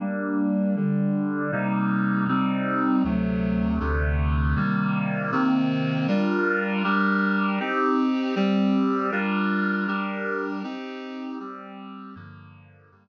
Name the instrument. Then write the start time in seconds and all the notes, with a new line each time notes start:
clarinet
0.00 G3 A#3 D4
0.76 D3 G3 D4
1.52 C3 G3 A#3 D#4
2.28 C3 G3 C4 D#4
3.04 D2 C3 F#3 A3
3.80 D2 C3 D3 A3
4.56 C3 D#3 G3 A#3
5.32 C3 D#3 A#3 C4
6.08 G3 D4 F4 A#4
6.84 G3 D4 G4 A#4
7.59 C4 D#4 G4
8.35 G3 C4 G4
9.11 G3 D4 F4 A#4
9.87 G3 D4 G4 A#4
10.63 C4 D#4 G4
11.39 G3 C4 G4
12.15 G2 D3 F3 A#3
12.91 G2 D3 G3 A#3